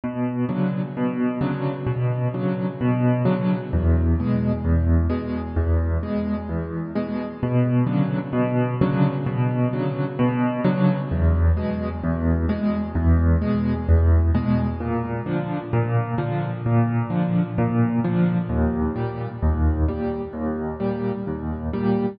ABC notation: X:1
M:4/4
L:1/8
Q:1/4=130
K:A
V:1 name="Acoustic Grand Piano" clef=bass
B,,2 [C,D,F,]2 B,,2 [C,D,F,]2 | B,,2 [C,D,F,]2 B,,2 [C,D,F,]2 | E,,2 [B,,G,]2 E,,2 [B,,G,]2 | E,,2 [B,,G,]2 E,,2 [B,,G,]2 |
B,,2 [C,D,F,]2 B,,2 [C,D,F,]2 | B,,2 [C,D,F,]2 B,,2 [C,D,F,]2 | E,,2 [B,,G,]2 E,,2 [B,,G,]2 | E,,2 [B,,G,]2 E,,2 [B,,G,]2 |
[K:Bb] B,,2 [D,F,]2 B,,2 [D,F,]2 | B,,2 [D,F,]2 B,,2 [D,F,]2 | E,,2 [B,,G,]2 E,,2 [B,,G,]2 | E,,2 [B,,G,]2 E,,2 [B,,G,]2 |]